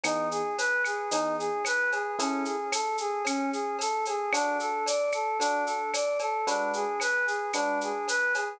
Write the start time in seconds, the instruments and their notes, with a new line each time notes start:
0.03 electric piano 1 E3 B3 D#4 G#4, choir aahs D#4, cowbell, claves, shaker
0.31 choir aahs G#4, shaker
0.58 choir aahs B4, cowbell, shaker
0.84 choir aahs G#4, claves, shaker
1.11 electric piano 1 E3 B3 D#4 G#4, choir aahs D#4, cowbell, shaker
1.39 choir aahs G#4, shaker
1.65 choir aahs B4, cowbell, claves, shaker
1.91 choir aahs G#4, cowbell, shaker
2.19 electric piano 1 C#4 E4 G#4 A4, choir aahs C#4, cowbell, shaker
2.45 choir aahs G#4, shaker
2.72 choir aahs A4, cowbell, claves, shaker
2.98 choir aahs G#4, shaker
3.25 choir aahs C#4, cowbell, claves, shaker
3.52 choir aahs G#4, shaker
3.79 choir aahs A4, cowbell, shaker
4.05 choir aahs G#4, cowbell, shaker
4.33 choir aahs D4, electric piano 1 D4 F#4 A4, cowbell, claves, shaker
4.60 choir aahs A4, shaker
4.86 choir aahs D5, cowbell, shaker
5.12 choir aahs A4, claves, shaker
5.39 choir aahs D4, electric piano 1 D4 F#4 A4, cowbell, shaker
5.66 choir aahs A4, shaker
5.93 choir aahs D5, cowbell, claves, shaker
6.19 choir aahs A4, cowbell, shaker
6.47 electric piano 1 G#3 D4 F#4 B4, choir aahs D4, cowbell, shaker
6.73 choir aahs G#4, shaker
7.00 choir aahs B4, cowbell, claves, shaker
7.26 choir aahs G#4, shaker
7.53 electric piano 1 G#3 D4 F#4 B4, choir aahs D4, cowbell, claves, shaker
7.81 choir aahs G#4, shaker
8.08 choir aahs B4, cowbell, shaker
8.34 choir aahs G#4, cowbell, shaker